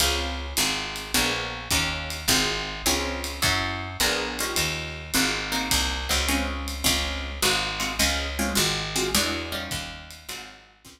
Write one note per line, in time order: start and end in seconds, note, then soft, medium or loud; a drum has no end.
0.00 0.54 C#2 medium
0.00 0.47 C4 loud
0.00 0.47 C#4 loud
0.00 0.47 F4 loud
0.00 0.47 G#4 loud
0.00 ride loud
0.57 1.12 G#1 medium
0.57 1.04 C4 loud
0.57 1.04 F4 loud
0.57 1.04 F#4 loud
0.57 1.04 G#4 loud
0.57 hi-hat pedal medium
0.57 ride loud
0.96 ride medium
1.14 1.69 A#1 medium
1.14 1.60 A#3 loud
1.14 1.60 B3 loud
1.14 1.60 D4 medium
1.14 1.60 G#4 loud
1.14 ride loud
1.70 2.26 D#2 medium
1.70 2.17 C#4 loud
1.70 2.17 D#4 loud
1.70 2.17 F4 loud
1.70 2.17 G4 loud
1.70 kick medium
1.70 hi-hat pedal medium
1.70 ride medium
2.10 ride medium
2.28 2.82 G#1 medium
2.28 2.75 C4 loud
2.28 2.75 F4 loud
2.28 2.75 F#4 medium
2.28 2.75 G#4 loud
2.28 kick medium
2.28 ride loud
2.86 3.40 C#2 medium
2.86 3.33 C4 loud
2.86 3.33 C#4 loud
2.86 3.33 F4 loud
2.86 3.33 G#4 loud
2.86 hi-hat pedal loud
2.86 ride loud
3.24 ride medium
3.42 3.97 F#2 medium
3.42 3.88 C#4 loud
3.42 3.88 E4 loud
3.42 3.88 F#4 loud
3.42 3.88 A4 loud
3.42 kick medium
3.42 ride loud
4.00 4.54 A#1 medium
4.00 4.37 B3 loud
4.00 4.37 D4 loud
4.00 4.37 G#4 loud
4.00 4.37 A#4 loud
4.00 hi-hat pedal medium
4.00 ride loud
4.39 5.05 C#4 loud
4.39 5.05 D#4 loud
4.39 5.05 F4 loud
4.39 5.05 G4 loud
4.39 ride medium
4.56 5.11 D#2 medium
4.56 ride loud
5.14 5.69 G#1 medium
5.14 5.51 C4 loud
5.14 5.51 F4 loud
5.14 5.51 F#4 loud
5.14 5.51 G#4 loud
5.14 hi-hat pedal loud
5.14 ride medium
5.52 5.98 A#3 loud
5.52 5.98 C4 loud
5.52 5.98 D#4 loud
5.52 5.98 F#4 loud
5.52 ride medium
5.71 6.08 C2 medium
5.71 kick medium
5.71 ride loud
6.09 6.83 C#2 medium
6.09 6.22 A#3 loud
6.09 6.22 C4 loud
6.09 6.22 D#4 loud
6.09 6.22 F#4 medium
6.28 6.75 G#3 loud
6.28 6.75 C4 loud
6.28 6.75 C#4 loud
6.28 6.75 F4 loud
6.28 hi-hat pedal medium
6.28 ride medium
6.68 ride medium
6.84 7.40 C#2 medium
6.84 7.30 G#3 loud
6.84 7.30 C4 loud
6.84 7.30 C#4 loud
6.84 7.30 F4 loud
6.84 kick medium
6.84 ride loud
7.42 7.97 G#1 medium
7.42 7.69 G#3 loud
7.42 7.69 C4 loud
7.42 7.69 F4 loud
7.42 7.69 F#4 loud
7.42 hi-hat pedal loud
7.42 ride loud
7.80 7.93 G#3 medium
7.80 7.93 C4 loud
7.80 7.93 F4 medium
7.80 7.93 F#4 loud
7.80 ride medium
7.99 8.54 C#2 medium
7.99 8.26 G#3 loud
7.99 8.26 C4 loud
7.99 8.26 C#4 loud
7.99 8.26 F4 loud
7.99 ride loud
8.39 8.52 G#3 loud
8.39 8.52 C4 medium
8.39 8.52 C#4 loud
8.39 8.52 F4 loud
8.55 9.11 G#1 medium
8.55 8.82 G#3 loud
8.55 8.82 C4 loud
8.55 8.82 F4 loud
8.55 8.82 F#4 loud
8.55 hi-hat pedal loud
8.55 ride medium
8.96 9.09 G#3 medium
8.96 9.09 C4 loud
8.96 9.09 F4 medium
8.96 9.09 F#4 medium
8.96 ride medium
9.15 9.69 E2 medium
9.15 9.51 G#3 loud
9.15 9.51 D4 loud
9.15 9.51 E4 loud
9.15 9.51 F#4 loud
9.15 ride loud
9.52 10.17 G3 loud
9.52 10.17 C#4 loud
9.52 10.17 D#4 loud
9.52 10.17 F4 loud
9.71 10.26 D#2 medium
9.71 kick medium
9.71 hi-hat pedal medium
9.71 ride medium
10.10 ride medium
10.29 10.83 G#1 medium
10.29 10.75 F#3 loud
10.29 10.75 G#3 loud
10.29 10.75 C4 loud
10.29 10.75 F4 loud
10.29 ride loud
10.85 11.00 C#2 medium
10.85 11.00 G#3 loud
10.85 11.00 C4 loud
10.85 11.00 C#4 loud
10.85 11.00 F4 loud
10.85 kick medium
10.85 hi-hat pedal medium
10.85 ride loud